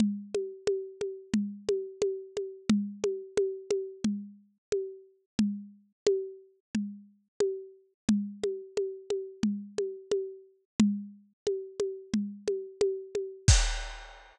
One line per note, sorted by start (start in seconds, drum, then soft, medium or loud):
0.00 low conga medium
0.35 high conga medium
0.67 high conga medium
1.01 high conga medium
1.34 low conga medium
1.69 high conga medium
2.02 high conga medium
2.37 high conga medium
2.70 low conga loud
3.04 high conga medium
3.37 high conga medium
3.71 high conga medium
4.04 low conga medium
4.72 high conga medium
5.39 low conga medium
6.07 high conga loud
6.75 low conga medium
7.40 high conga medium
8.09 low conga loud
8.44 high conga medium
8.77 high conga medium
9.10 high conga medium
9.43 low conga medium
9.78 high conga medium
10.12 high conga medium
10.80 low conga loud
11.47 high conga medium
11.80 high conga medium
12.14 low conga medium
12.48 high conga medium
12.81 high conga medium
13.15 high conga medium
13.48 kick loud
13.48 crash loud